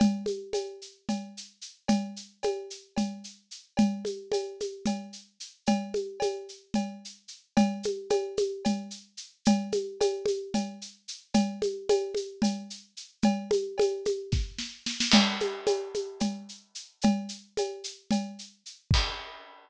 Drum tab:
CC |--------------|--------------|--------------|--------------|
SH |x-x-x-x-x-x-x-|x-x-x-x-x-x-x-|x-x-x-x-x-x-x-|x-x-x-x-x-x-x-|
CB |x---x---x-----|x---x---x-----|x---x---x-----|x---x---x-----|
SD |--------------|--------------|--------------|--------------|
CG |O-o-o---O-----|O---o---O-----|O-o-o-o-O-----|O-o-o---O-----|
BD |--------------|--------------|--------------|--------------|

CC |--------------|--------------|--------------|--------------|
SH |x-x-x-x-x-x-x-|x-x-x-x-x-x-x-|x-x-x-x-x-x-x-|x-x-x-x-------|
CB |x---x---x-----|x---x---x-----|x---x---x-----|x---x---------|
SD |--------------|--------------|--------------|--------o-o-oo|
CG |O-o-o-o-O-----|O-o-o-o-O-----|O-o-o-o-O-----|O-o-o-o-------|
BD |--------------|--------------|--------------|--------o-----|

CC |x-------------|--------------|x-------------|
SH |x-x-x-x-x-x-x-|x-x-x-x-x-x-x-|--------------|
CB |x---x---x-----|x---x---x-----|--------------|
SD |--------------|--------------|--------------|
CG |O-o-o-o-O-----|O---o---O-----|--------------|
BD |--------------|--------------|o-------------|